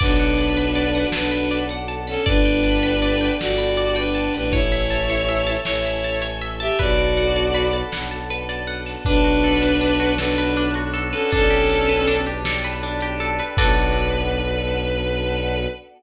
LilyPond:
<<
  \new Staff \with { instrumentName = "Violin" } { \time 12/8 \key b \minor \tempo 4. = 106 <d' b'>2. <d' b'>4. r4 <cis' a'>8 | <d' b'>2. <fis' d''>4. <d' b'>4 <d' b'>8 | <e' cis''>2. <e' cis''>4. r4 <g' e''>8 | <fis' d''>2~ <fis' d''>8 r2. r8 |
<d' b'>2. <d' b'>4. r4 <cis' a'>8 | <cis' a'>2~ <cis' a'>8 r2. r8 | b'1. | }
  \new Staff \with { instrumentName = "Orchestral Harp" } { \time 12/8 \key b \minor d''8 fis''8 a''8 b''8 d''8 fis''8 a''8 b''8 d''8 fis''8 a''8 b''8 | d''8 g''8 a''8 b''8 d''8 g''8 a''8 b''8 d''8 g''8 a''8 b''8 | cis''8 e''8 a''8 cis''8 e''8 a''8 cis''8 e''8 a''8 cis''8 e''8 a''8 | b'8 d''8 fis''8 a''8 b'8 d''8 fis''8 a''8 b'8 d''8 fis''8 a''8 |
d'8 fis'8 a'8 b'8 d'8 fis'8 a'8 b'8 d'8 fis'8 a'8 b'8 | d'8 g'8 a'8 b'8 d'8 g'8 a'8 b'8 d'8 g'8 a'8 b'8 | <d' fis' a' b'>1. | }
  \new Staff \with { instrumentName = "Violin" } { \clef bass \time 12/8 \key b \minor b,,2. b,,2. | g,,2. g,,2~ g,,8 a,,8~ | a,,2. a,,2. | b,,2. b,,2. |
b,,1. | b,,1. | b,,1. | }
  \new Staff \with { instrumentName = "Choir Aahs" } { \time 12/8 \key b \minor <b d' fis' a'>1. | <b d' g' a'>1. | <cis' e' a'>1. | <b d' fis' a'>1. |
<b' d'' fis'' a''>1. | <b' d'' g'' a''>1. | <b d' fis' a'>1. | }
  \new DrumStaff \with { instrumentName = "Drums" } \drummode { \time 12/8 <cymc bd>8 hh8 hh8 hh8 hh8 hh8 sn8 hh8 hh8 hh8 hh8 hho8 | <hh bd>8 hh8 hh8 hh8 hh8 hh8 sn8 hh8 hh8 hh8 hh8 hho8 | <hh bd>8 hh8 hh8 hh8 hh8 hh8 sn8 hh8 hh8 hh8 hh8 hh8 | <hh bd>8 hh8 hh8 hh8 hh8 hh8 sn8 hh8 hh8 hh8 hh8 hho8 |
<hh bd>8 hh8 hh8 hh8 hh8 hh8 sn8 hh8 hh8 hh8 hh8 hh8 | <hh bd>8 hh8 hh8 hh8 hh8 hh8 sn8 hh8 hh8 hh8 hh8 hh8 | <cymc bd>4. r4. r4. r4. | }
>>